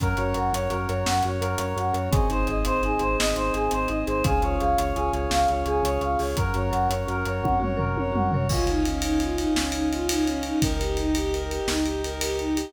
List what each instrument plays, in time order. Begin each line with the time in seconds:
0.00 synth bass 2 F#2, marimba C#4, brass section A#4 C#5 F#5, choir aahs A#4, kick, closed hi-hat
0.17 synth bass 2 F#2, marimba F#4, choir aahs C#5, closed hi-hat
0.34 synth bass 2 F#2, marimba A#4, choir aahs F#5, closed hi-hat
0.53 synth bass 2 F#2, marimba C#4, choir aahs C#5, closed hi-hat
0.70 synth bass 2 F#2, marimba F#4, choir aahs A#4, closed hi-hat
0.87 synth bass 2 F#2, marimba A#4, choir aahs C#5, closed hi-hat
1.06 synth bass 2 F#2, marimba C#4, choir aahs F#5, snare
1.23 synth bass 2 F#2, marimba F#4, choir aahs C#5, closed hi-hat
1.40 synth bass 2 F#2, choir aahs A#4, marimba A#4, closed hi-hat
1.58 synth bass 2 F#2, marimba C#4, choir aahs C#5, closed hi-hat
1.76 synth bass 2 F#2, marimba F#4, choir aahs F#5, closed hi-hat
1.94 synth bass 2 F#2, marimba A#4, choir aahs C#5, closed hi-hat
2.11 synth bass 2 G#1, marimba C4, choir aahs G#4, brass section G#4 C5 D#5, kick, closed hi-hat
2.29 synth bass 2 G#1, marimba D#4, choir aahs C5, closed hi-hat
2.47 synth bass 2 G#1, marimba G#4, choir aahs D#5, closed hi-hat
2.65 synth bass 2 G#1, marimba C4, choir aahs C5, closed hi-hat
2.83 synth bass 2 G#1, marimba D#4, choir aahs G#4, closed hi-hat
2.99 synth bass 2 G#1, marimba G#4, choir aahs C5, closed hi-hat
3.19 synth bass 2 G#1, marimba C4, choir aahs D#5, snare
3.36 synth bass 2 G#1, marimba D#4, choir aahs C5, closed hi-hat
3.54 synth bass 2 G#1, marimba G#4, choir aahs G#4, closed hi-hat
3.71 synth bass 2 G#1, marimba C4, choir aahs C5, closed hi-hat
3.88 synth bass 2 G#1, marimba D#4, choir aahs D#5, closed hi-hat
4.07 synth bass 2 G#1, marimba G#4, choir aahs C5, closed hi-hat
4.24 synth bass 2 C#2, marimba C#4, brass section G#4 C#5 F5, choir aahs G#4, kick, closed hi-hat
4.42 synth bass 2 C#2, marimba F4, choir aahs C#5, closed hi-hat
4.60 synth bass 2 C#2, marimba G#4, choir aahs F5, closed hi-hat
4.78 synth bass 2 C#2, marimba C#4, choir aahs C#5, closed hi-hat
4.95 synth bass 2 C#2, marimba F4, choir aahs G#4, closed hi-hat
5.12 synth bass 2 C#2, marimba G#4, choir aahs C#5, closed hi-hat
5.30 synth bass 2 C#2, marimba C#4, choir aahs F5, snare
5.48 synth bass 2 C#2, marimba F4, choir aahs C#5, closed hi-hat
5.66 synth bass 2 C#2, choir aahs G#4, marimba G#4, closed hi-hat
5.83 synth bass 2 C#2, marimba C#4, choir aahs C#5, closed hi-hat
6.01 synth bass 2 C#2, marimba F4, choir aahs F5, closed hi-hat
6.19 synth bass 2 C#2, marimba G#4, choir aahs C#5, open hi-hat
6.36 synth bass 2 F#2, marimba C#4, choir aahs A#4, brass section A#4 C#5 F#5, kick, closed hi-hat
6.54 synth bass 2 F#2, marimba F#4, choir aahs C#5, closed hi-hat
6.71 synth bass 2 F#2, marimba A#4, choir aahs F#5, closed hi-hat
6.88 synth bass 2 F#2, marimba C#4, choir aahs C#5, closed hi-hat
7.08 synth bass 2 F#2, marimba F#4, choir aahs A#4, closed hi-hat
7.25 synth bass 2 F#2, marimba A#4, choir aahs C#5, closed hi-hat
7.42 synth bass 2 F#2, marimba C#4, choir aahs F#5, kick, high tom
7.60 synth bass 2 F#2, marimba F#4, choir aahs C#5, mid tom
7.77 synth bass 2 F#2, marimba A#4, choir aahs A#4, floor tom
7.96 synth bass 2 F#2, marimba C#4, choir aahs C#5, high tom
8.12 synth bass 2 F#2, marimba F#4, choir aahs F#5, mid tom
8.32 synth bass 2 F#2, marimba A#4, choir aahs C#5, floor tom
8.49 synth bass 2 C#2, violin F4, brass section C#5 D#5 F5 G#5, kick, crash
8.67 violin D#4, ride
8.84 violin C#4, ride
9.02 violin D#4, ride
9.20 violin F4, ride
9.36 violin D#4, ride
9.55 synth bass 2 C#2, violin C#4, snare
9.72 violin D#4, ride
9.91 violin F4, ride
10.09 violin D#4, ride
10.25 violin C#4, ride
10.43 violin D#4, ride
10.62 synth bass 2 C#2, violin A#4, brass section D#5 G5 A#5, kick, ride
10.80 violin G4, ride
10.97 violin D#4, ride
11.15 violin G4, ride
11.32 violin A#4, ride
11.50 violin G4, ride
11.67 synth bass 2 C#2, violin D#4, snare
11.84 violin G4, ride
12.04 violin A#4, ride
12.21 violin G4, ride
12.39 violin D#4, ride
12.55 violin G4, ride